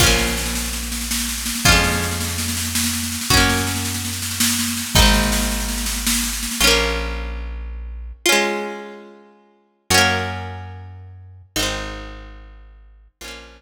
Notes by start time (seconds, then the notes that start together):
0.00 A#1 C#4 F4, kick, snare, crash
0.06 A#3, snare
0.19 snare
0.27 snare
0.37 snare
0.46 snare
0.55 snare
0.65 snare
0.73 snare
0.83 snare
0.92 snare
1.01 snare
1.11 snare
1.18 snare
1.29 snare
1.38 snare
1.46 snare
1.55 snare
1.65 F2 C#4 F4, kick, snare
1.72 G#3, snare
1.84 snare
1.92 snare
2.02 snare
2.11 snare
2.20 snare
2.28 snare
2.38 snare
2.48 snare
2.57 snare
2.65 snare
2.75 snare
2.84 snare
2.93 snare
3.03 snare
3.12 snare
3.21 snare
3.30 F#2 C#4 F#4, kick, snare
3.37 A#3, snare
3.49 snare
3.57 snare
3.67 snare
3.76 snare
3.85 snare
3.94 snare
4.05 snare
4.13 snare
4.22 snare
4.31 snare
4.40 snare
4.50 snare
4.59 snare
4.68 snare
4.77 snare
4.86 snare
4.95 G#1 C4 D#4, kick, snare
5.02 G#3, snare
5.14 snare
5.23 snare
5.32 snare
5.42 snare
5.51 snare
5.60 snare
5.68 snare
5.78 snare
5.86 snare
5.96 snare
6.07 snare
6.14 snare
6.24 snare
6.33 snare
6.43 snare
6.51 snare
6.60 A#1 C#4 F4
6.67 A#3
8.26 C#4 F4
8.32 G#3
9.90 F#2 C#4 F#4
9.98 A#3
11.56 G#1 C4 D#4
11.63 G#3
13.21 A#1 C#4 F4
13.28 A#3